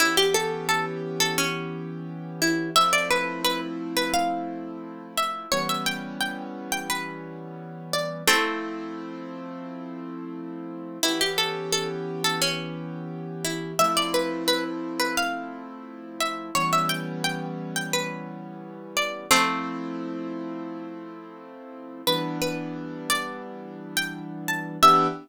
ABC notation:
X:1
M:4/4
L:1/16
Q:1/4=87
K:Ephr
V:1 name="Pizzicato Strings"
E G A2 A z2 A ^C4 z2 E2 | e d B2 B z2 B f4 z2 e2 | ^c e g2 g z2 g B4 z2 d2 | [A,C]10 z6 |
E G A2 A z2 A ^C4 z2 E2 | e d B2 B z2 B f4 z2 e2 | ^c e g2 g z2 g B4 z2 d2 | [A,C]10 z6 |
B2 B4 d2 z3 g z2 a2 | e4 z12 |]
V:2 name="Acoustic Grand Piano"
[E,B,^CG]16 | [F,A,CE]16 | [E,G,B,^C]16 | [F,A,CE]16 |
[E,B,^CG]16 | [F,A,CE]16 | [E,G,B,^C]16 | [F,A,CE]16 |
[E,G,B,D]16 | [E,B,DG]4 z12 |]